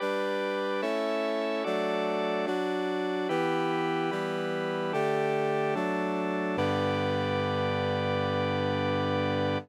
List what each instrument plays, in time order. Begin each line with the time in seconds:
0.00 brass section G3 D4 B4, drawbar organ G4 B4 D5
0.82 brass section A3 C#4 E4, drawbar organ A4 C#5 E5
1.64 brass section F#3 A3 D4, drawbar organ F#4 A4 D5
2.47 brass section F#3 D4 F#4, drawbar organ D4 F#4 D5
3.29 brass section E3 B3 G4, drawbar organ E4 G4 B4
4.11 brass section E3 G3 G4, drawbar organ B3 E4 B4
4.93 brass section D3 A3 G4, drawbar organ D4 G4 A4
5.75 drawbar organ F#3 D4 A4, brass section F#3 A3 D4
6.57 brass section G2 D3 B3, drawbar organ G4 B4 D5